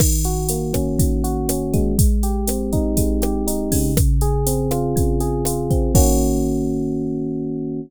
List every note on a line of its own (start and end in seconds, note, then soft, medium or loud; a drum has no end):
0.00 0.99 D#3 loud
0.00 kick medium
0.00 cross-stick loud
0.00 crash loud
0.24 1.23 F#4 medium
0.24 closed hi-hat medium
0.49 1.91 A#3 medium
0.49 closed hi-hat loud
0.73 1.49 C#4 medium
0.73 kick medium
0.73 cross-stick loud
0.73 closed hi-hat medium
0.99 1.93 D#3 medium
0.99 kick medium
0.99 closed hi-hat loud
1.24 1.95 F#4 medium
1.24 closed hi-hat medium
1.49 1.96 C#4 medium
1.49 cross-stick medium
1.49 closed hi-hat loud
1.73 2.97 G#3 loud
1.73 kick medium
1.73 closed hi-hat medium
1.99 kick loud
1.99 closed hi-hat loud
2.23 3.22 G4 medium
2.23 closed hi-hat medium
2.48 3.89 C4 medium
2.48 cross-stick medium
2.48 closed hi-hat loud
2.73 3.47 D#4 loud
2.73 kick medium
2.73 closed hi-hat medium
2.97 3.92 G#3 medium
2.97 kick medium
2.97 closed hi-hat loud
3.22 3.93 G4 medium
3.22 cross-stick loud
3.22 closed hi-hat medium
3.47 3.94 D#4 medium
3.47 closed hi-hat loud
3.72 4.95 C#3 loud
3.72 kick medium
3.72 open hi-hat medium
3.97 kick loud
3.97 cross-stick loud
3.97 closed hi-hat loud
4.21 5.20 G#4 loud
4.21 closed hi-hat medium
4.47 5.70 C4 medium
4.47 closed hi-hat loud
4.71 5.45 F4 loud
4.71 cross-stick medium
4.71 closed hi-hat medium
4.96 5.90 C#3 loud
4.96 kick medium
4.96 closed hi-hat medium
5.20 5.91 G#4 medium
5.20 closed hi-hat medium
5.45 5.92 F4 medium
5.45 cross-stick medium
5.45 closed hi-hat loud
5.70 5.94 C4 medium
5.70 kick medium
5.70 closed hi-hat medium
5.95 7.80 D#3 medium
5.95 7.80 A#3 loud
5.95 7.80 C#4 loud
5.95 7.80 F#4 loud
5.95 kick loud
5.95 crash loud